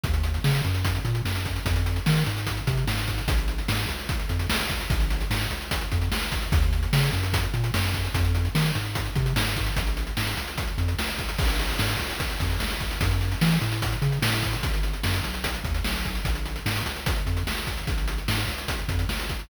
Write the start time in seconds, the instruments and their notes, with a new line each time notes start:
0.03 synth bass 1 D#2, kick, closed hi-hat
0.14 closed hi-hat
0.23 closed hi-hat
0.34 closed hi-hat
0.44 synth bass 1 C#3, snare
0.54 closed hi-hat
0.64 synth bass 1 F#2, closed hi-hat
0.74 closed hi-hat
0.85 kick, closed hi-hat
0.95 closed hi-hat
1.05 synth bass 1 A#2, closed hi-hat
1.15 closed hi-hat
1.25 synth bass 1 F#2, snare
1.35 closed hi-hat
1.45 kick, closed hi-hat
1.56 closed hi-hat
1.65 synth bass 1 F2, kick, closed hi-hat
1.76 closed hi-hat
1.86 closed hi-hat
1.96 closed hi-hat
2.06 synth bass 1 D#3, snare
2.16 closed hi-hat
2.26 synth bass 1 G#2, closed hi-hat
2.37 closed hi-hat
2.47 kick, closed hi-hat
2.57 closed hi-hat
2.67 synth bass 1 C3, kick, closed hi-hat
2.77 closed hi-hat
2.87 synth bass 1 G#2, snare
2.98 closed hi-hat
3.07 kick, closed hi-hat
3.18 closed hi-hat
3.28 synth bass 1 A#1, kick, closed hi-hat
3.38 closed hi-hat
3.48 closed hi-hat
3.58 closed hi-hat
3.68 synth bass 1 G#2, snare
3.79 closed hi-hat
3.89 synth bass 1 C#2, closed hi-hat
3.99 closed hi-hat
4.09 kick, closed hi-hat
4.19 closed hi-hat
4.29 synth bass 1 F2, closed hi-hat
4.39 closed hi-hat
4.49 synth bass 1 C#2, snare
4.60 closed hi-hat
4.70 kick, closed hi-hat
4.80 closed hi-hat
4.90 synth bass 1 A#1, kick, closed hi-hat
5.00 closed hi-hat
5.10 closed hi-hat
5.21 closed hi-hat
5.30 synth bass 1 G#2, snare
5.41 closed hi-hat
5.51 synth bass 1 C#2, closed hi-hat
5.61 closed hi-hat
5.71 kick, closed hi-hat
5.81 closed hi-hat
5.92 synth bass 1 F2, kick, closed hi-hat
6.02 closed hi-hat
6.11 synth bass 1 C#2, snare
6.22 closed hi-hat
6.32 kick, closed hi-hat
6.42 closed hi-hat
6.52 synth bass 1 D#2, kick, closed hi-hat
6.62 closed hi-hat
6.73 closed hi-hat
6.83 closed hi-hat
6.93 synth bass 1 C#3, snare
7.03 closed hi-hat
7.13 synth bass 1 F#2, closed hi-hat
7.23 closed hi-hat
7.33 kick, closed hi-hat
7.43 closed hi-hat
7.54 synth bass 1 A#2, closed hi-hat
7.64 closed hi-hat
7.74 synth bass 1 F#2, snare
7.84 closed hi-hat
7.94 kick, closed hi-hat
8.04 closed hi-hat
8.14 synth bass 1 F2, kick, closed hi-hat
8.25 closed hi-hat
8.35 closed hi-hat
8.45 closed hi-hat
8.55 synth bass 1 D#3, snare
8.65 closed hi-hat
8.75 synth bass 1 G#2, closed hi-hat
8.85 closed hi-hat
8.95 kick, closed hi-hat
9.05 closed hi-hat
9.15 synth bass 1 C3, kick, closed hi-hat
9.26 closed hi-hat
9.36 synth bass 1 G#2, snare
9.46 closed hi-hat
9.56 kick, closed hi-hat
9.66 closed hi-hat
9.76 synth bass 1 A#1, kick, closed hi-hat
9.87 closed hi-hat
9.97 closed hi-hat
10.07 closed hi-hat
10.17 synth bass 1 G#2, snare
10.27 closed hi-hat
10.37 synth bass 1 C#2, closed hi-hat
10.47 closed hi-hat
10.58 kick, closed hi-hat
10.67 closed hi-hat
10.78 synth bass 1 F2, closed hi-hat
10.88 closed hi-hat
10.98 synth bass 1 C#2, snare
11.08 closed hi-hat
11.18 kick, closed hi-hat
11.29 closed hi-hat
11.38 synth bass 1 A#1, kick, crash
11.49 closed hi-hat
11.59 closed hi-hat
11.69 closed hi-hat
11.79 synth bass 1 G#2, snare
11.89 closed hi-hat
11.99 synth bass 1 C#2, closed hi-hat
12.10 closed hi-hat
12.20 kick, closed hi-hat
12.30 closed hi-hat
12.40 synth bass 1 F2, kick, closed hi-hat
12.50 closed hi-hat
12.60 synth bass 1 C#2, snare
12.70 closed hi-hat
12.80 kick, closed hi-hat
12.91 closed hi-hat
13.01 synth bass 1 F#2, kick, closed hi-hat
13.11 closed hi-hat
13.21 closed hi-hat
13.32 closed hi-hat
13.41 synth bass 1 E3, snare
13.51 closed hi-hat
13.61 synth bass 1 A2, closed hi-hat
13.72 closed hi-hat
13.82 kick, closed hi-hat
13.92 closed hi-hat
14.02 synth bass 1 C#3, closed hi-hat
14.12 closed hi-hat
14.22 synth bass 1 A2, snare
14.33 closed hi-hat
14.43 kick, closed hi-hat
14.53 closed hi-hat
14.63 synth bass 1 G#1, kick, closed hi-hat
14.73 closed hi-hat
14.83 closed hi-hat
14.93 closed hi-hat
15.03 synth bass 1 F#2, snare
15.14 closed hi-hat
15.24 synth bass 1 B1, closed hi-hat
15.34 closed hi-hat
15.44 kick, closed hi-hat
15.54 closed hi-hat
15.64 synth bass 1 D#2, kick, closed hi-hat
15.74 closed hi-hat
15.84 synth bass 1 B1, snare
15.95 closed hi-hat
16.05 kick, closed hi-hat
16.15 closed hi-hat
16.25 synth bass 1 A#1, kick, closed hi-hat
16.35 closed hi-hat
16.45 closed hi-hat
16.56 closed hi-hat
16.66 synth bass 1 G#2, snare
16.76 closed hi-hat
16.86 synth bass 1 C#2, closed hi-hat
16.96 closed hi-hat
17.06 kick, closed hi-hat
17.16 closed hi-hat
17.26 synth bass 1 F2, closed hi-hat
17.37 closed hi-hat
17.47 synth bass 1 C#2, snare
17.57 closed hi-hat
17.67 kick, closed hi-hat
17.77 closed hi-hat
17.87 synth bass 1 A#1, kick, closed hi-hat
17.98 closed hi-hat
18.08 closed hi-hat
18.18 closed hi-hat
18.28 synth bass 1 G#2, snare
18.38 closed hi-hat
18.48 synth bass 1 C#2, closed hi-hat
18.58 closed hi-hat
18.68 kick, closed hi-hat
18.78 closed hi-hat
18.88 synth bass 1 F2, kick, closed hi-hat
18.99 closed hi-hat
19.09 synth bass 1 C#2, snare
19.19 closed hi-hat
19.29 kick, closed hi-hat
19.39 closed hi-hat